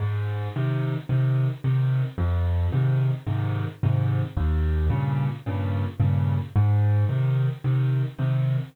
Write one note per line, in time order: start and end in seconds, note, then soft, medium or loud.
0.00 0.48 G#2 medium
0.56 0.94 C3 medium
0.56 0.94 D#3 medium
1.09 1.47 C3 medium
1.09 1.47 D#3 medium
1.64 2.02 C3 medium
1.64 2.02 D#3 medium
2.18 2.67 F2 medium
2.72 3.11 G#2 medium
2.72 3.11 C3 medium
2.72 3.11 D#3 medium
3.26 3.65 G#2 medium
3.26 3.65 C3 medium
3.26 3.65 D#3 medium
3.83 4.21 G#2 medium
3.83 4.21 C3 medium
3.83 4.21 D#3 medium
4.37 4.86 D#2 loud
4.90 5.28 G2 medium
4.90 5.28 A#2 medium
4.90 5.28 C#3 medium
5.46 5.84 G2 medium
5.46 5.84 A#2 medium
5.46 5.84 C#3 medium
6.00 6.38 G2 medium
6.00 6.38 A#2 medium
6.00 6.38 C#3 medium
6.56 7.05 G#2 loud
7.09 7.47 C3 medium
7.09 7.47 D#3 medium
7.64 8.02 C3 medium
7.64 8.02 D#3 medium
8.18 8.57 C3 medium
8.18 8.57 D#3 medium